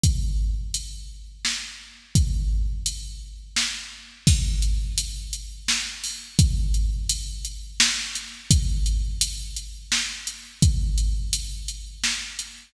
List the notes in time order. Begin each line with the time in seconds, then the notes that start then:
0.04 kick, closed hi-hat
0.74 closed hi-hat
1.45 snare
2.15 kick, closed hi-hat
2.86 closed hi-hat
3.56 snare
4.27 kick, crash
4.62 closed hi-hat
4.98 closed hi-hat
5.33 closed hi-hat
5.68 snare
6.04 open hi-hat
6.39 kick, closed hi-hat
6.74 closed hi-hat
7.09 closed hi-hat
7.45 closed hi-hat
7.80 snare
8.15 closed hi-hat
8.51 kick, closed hi-hat
8.86 closed hi-hat
9.21 closed hi-hat
9.56 closed hi-hat
9.92 snare
10.27 closed hi-hat
10.62 kick, closed hi-hat
10.98 closed hi-hat
11.33 closed hi-hat
11.68 closed hi-hat
12.04 snare
12.39 closed hi-hat